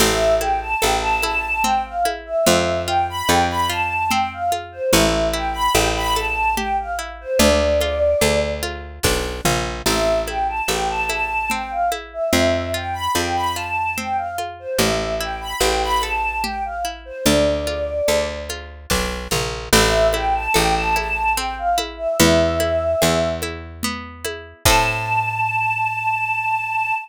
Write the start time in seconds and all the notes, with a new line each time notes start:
0.00 A1 C4 E5, crash, low conga
0.40 E4 G5, high conga
0.61 A5
0.82 A1 A4 G5, high conga
1.01 A5
1.22 E4 A5, high conga
1.63 C4 G5, low conga
1.85 F5
2.05 E4, high conga
2.26 E5
2.46 F2 C4 E5, low conga
2.87 F4 G5
3.09 B5
3.29 F2 A4 G5, high conga
3.50 B5
3.70 F4 A5
4.10 C4 G5, low conga
4.33 F5
4.52 F4, high conga
4.72 C5
4.93 A1 C#4 E5, low conga
5.33 E4 G5
5.53 B5
5.74 A1 G4 G5, high conga
5.96 B5
6.16 A4 A5, high conga
6.57 G4 G5, low conga
6.80 F5
6.99 E4
7.21 C5
7.39 D2 D4 D5, low conga
7.81 F4, high conga
8.21 D2 A4, high conga
8.63 F4, high conga
9.03 B1 D4, kick, snare
9.45 A#1 F4, mid tom
9.86 A1 C4 E5, crash, low conga
10.27 E4 G5, high conga
10.49 A5
10.68 A1 A4 G5, high conga
10.89 A5
11.09 E4 A5, high conga
11.50 C4 G5, low conga
11.70 F5
11.92 E4, high conga
12.13 E5
12.33 F2 C4 E5, low conga
12.74 F4 G5
12.93 B5
13.15 F2 A4 G5, high conga
13.36 B5
13.55 F4 A5
13.97 C4 G5, low conga
14.17 F5
14.38 F4, high conga
14.59 C5
14.78 A1 C#4 E5, low conga
15.21 E4 G5
15.41 B5
15.60 A1 G4 G5, high conga
15.83 B5
16.02 A4 A5, high conga
16.44 G4 G5, low conga
16.65 F5
16.85 E4
17.05 C5
17.25 D2 D4 D5, low conga
17.67 F4, high conga
18.08 D2 A4, high conga
18.49 F4, high conga
18.90 B1 D4, kick, snare
19.31 A#1 F4, mid tom
19.73 A1 C4 E5, crash, low conga
20.13 E4 G5, high conga
20.35 A5
20.54 A1 A4 G5, high conga
20.75 A5
20.96 E4 A5, high conga
21.35 C4 G5, high conga
21.58 F5
21.78 E4, high conga
21.97 E5
22.19 E2 B3 E5, low conga
22.60 E4, high conga
23.02 E2 G#4, high conga
23.42 E4, high conga
23.83 B3, low conga
24.24 E4, high conga
24.65 A2 C4 E4 A5, kick, crash
24.70 A4